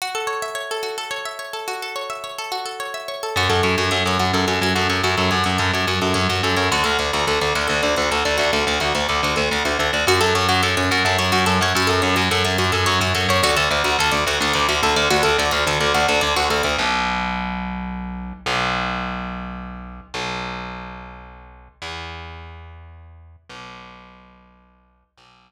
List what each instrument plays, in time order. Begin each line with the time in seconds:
0.02 pizzicato strings F#4
0.15 pizzicato strings A4
0.27 pizzicato strings C#5
0.42 pizzicato strings E5
0.55 pizzicato strings C#5
0.71 pizzicato strings A4
0.83 pizzicato strings F#4
0.98 pizzicato strings A4
1.11 pizzicato strings C#5
1.25 pizzicato strings E5
1.39 pizzicato strings C#5
1.53 pizzicato strings A4
1.68 pizzicato strings F#4
1.82 pizzicato strings A4
1.96 pizzicato strings C#5
2.10 pizzicato strings E5
2.24 pizzicato strings C#5
2.38 pizzicato strings A4
2.52 pizzicato strings F#4
2.66 pizzicato strings A4
2.80 pizzicato strings C#5
2.94 pizzicato strings E5
3.08 pizzicato strings C#5
3.23 pizzicato strings A4
3.36 electric bass (finger) F#2, pizzicato strings F#4
3.49 electric bass (finger) F#2, pizzicato strings A4
3.63 electric bass (finger) F#2, pizzicato strings C#5
3.78 electric bass (finger) F#2, pizzicato strings F#4
3.91 electric bass (finger) F#2, pizzicato strings A4
4.06 electric bass (finger) F#2, pizzicato strings C#5
4.19 electric bass (finger) F#2, pizzicato strings F#4
4.33 electric bass (finger) F#2, pizzicato strings A4
4.48 electric bass (finger) F#2, pizzicato strings C#5
4.61 electric bass (finger) F#2, pizzicato strings F#4
4.75 electric bass (finger) F#2, pizzicato strings A4
4.90 electric bass (finger) F#2, pizzicato strings C#5
5.03 electric bass (finger) F#2, pizzicato strings F#4
5.17 electric bass (finger) F#2, pizzicato strings A4
5.31 electric bass (finger) F#2, pizzicato strings C#5
5.44 electric bass (finger) F#2, pizzicato strings F#4
5.58 electric bass (finger) F#2, pizzicato strings A4
5.73 electric bass (finger) F#2, pizzicato strings C#5
5.87 electric bass (finger) F#2, pizzicato strings F#4
6.02 electric bass (finger) F#2, pizzicato strings A4
6.14 electric bass (finger) F#2, pizzicato strings C#5
6.29 electric bass (finger) F#2, pizzicato strings F#4
6.43 electric bass (finger) F#2, pizzicato strings A4
6.57 electric bass (finger) F#2, pizzicato strings C#5
6.72 electric bass (finger) D2, pizzicato strings F#4
6.84 electric bass (finger) D2, pizzicato strings A4
6.99 electric bass (finger) D2, pizzicato strings D5
7.13 electric bass (finger) D2, pizzicato strings F#4
7.27 electric bass (finger) D2, pizzicato strings A4
7.41 electric bass (finger) D2, pizzicato strings D5
7.55 electric bass (finger) D2, pizzicato strings F#4
7.68 electric bass (finger) D2, pizzicato strings A4
7.83 electric bass (finger) D2, pizzicato strings D5
7.96 electric bass (finger) D2, pizzicato strings F#4
8.11 electric bass (finger) D2, pizzicato strings A4
8.25 electric bass (finger) D2, pizzicato strings D5
8.38 electric bass (finger) D2, pizzicato strings F#4
8.53 electric bass (finger) D2, pizzicato strings A4
8.67 electric bass (finger) D2, pizzicato strings D5
8.80 electric bass (finger) D2, pizzicato strings F#4
8.95 electric bass (finger) D2, pizzicato strings A4
9.09 electric bass (finger) D2, pizzicato strings D5
9.23 electric bass (finger) D2, pizzicato strings F#4
9.36 electric bass (finger) D2, pizzicato strings A4
9.51 electric bass (finger) D2, pizzicato strings D5
9.65 electric bass (finger) D2, pizzicato strings F#4
9.79 electric bass (finger) D2, pizzicato strings A4
9.93 electric bass (finger) D2, pizzicato strings D5
10.07 electric bass (finger) F#2, pizzicato strings F#4
10.21 electric bass (finger) F#2, pizzicato strings A4
10.35 electric bass (finger) F#2, pizzicato strings C#5
10.49 electric bass (finger) F#2, pizzicato strings F#4
10.63 electric bass (finger) F#2, pizzicato strings A4
10.77 electric bass (finger) F#2, pizzicato strings C#5
10.91 electric bass (finger) F#2, pizzicato strings F#4
11.05 electric bass (finger) F#2, pizzicato strings A4
11.18 electric bass (finger) F#2, pizzicato strings C#5
11.32 electric bass (finger) F#2, pizzicato strings F#4
11.46 electric bass (finger) F#2, pizzicato strings A4
11.61 electric bass (finger) F#2, pizzicato strings C#5
11.75 electric bass (finger) F#2, pizzicato strings F#4
11.87 electric bass (finger) F#2, pizzicato strings A4
12.02 electric bass (finger) F#2, pizzicato strings C#5
12.16 electric bass (finger) F#2, pizzicato strings F#4
12.31 electric bass (finger) F#2, pizzicato strings A4
12.45 electric bass (finger) F#2, pizzicato strings C#5
12.58 electric bass (finger) F#2, pizzicato strings F#4
12.72 electric bass (finger) F#2, pizzicato strings A4
12.86 electric bass (finger) F#2, pizzicato strings C#5
13.01 electric bass (finger) F#2, pizzicato strings F#4
13.15 electric bass (finger) F#2, pizzicato strings A4
13.29 electric bass (finger) F#2, pizzicato strings C#5
13.43 electric bass (finger) D2, pizzicato strings F#4
13.57 electric bass (finger) D2, pizzicato strings A4
13.71 electric bass (finger) D2, pizzicato strings D5
13.84 electric bass (finger) D2, pizzicato strings F#4
13.99 electric bass (finger) D2, pizzicato strings A4
14.11 electric bass (finger) D2, pizzicato strings D5
14.27 electric bass (finger) D2, pizzicato strings F#4
14.40 electric bass (finger) D2, pizzicato strings A4
14.53 electric bass (finger) D2, pizzicato strings D5
14.69 electric bass (finger) D2, pizzicato strings F#4
14.83 electric bass (finger) D2, pizzicato strings A4
14.96 electric bass (finger) D2, pizzicato strings D5
15.10 electric bass (finger) D2, pizzicato strings F#4
15.23 electric bass (finger) D2, pizzicato strings A4
15.38 electric bass (finger) D2, pizzicato strings D5
15.51 electric bass (finger) D2, pizzicato strings F#4
15.67 electric bass (finger) D2, pizzicato strings A4
15.80 electric bass (finger) D2, pizzicato strings D5
15.94 electric bass (finger) D2, pizzicato strings F#4
16.08 electric bass (finger) D2, pizzicato strings A4
16.21 electric bass (finger) D2, pizzicato strings D5
16.36 electric bass (finger) D2, pizzicato strings F#4
16.50 electric bass (finger) D2, pizzicato strings A4
16.63 electric bass (finger) D2, pizzicato strings D5
16.78 electric bass (finger) B1
18.46 electric bass (finger) B1
20.14 electric bass (finger) B1
21.82 electric bass (finger) E2
23.49 electric bass (finger) B1
25.18 electric bass (finger) B1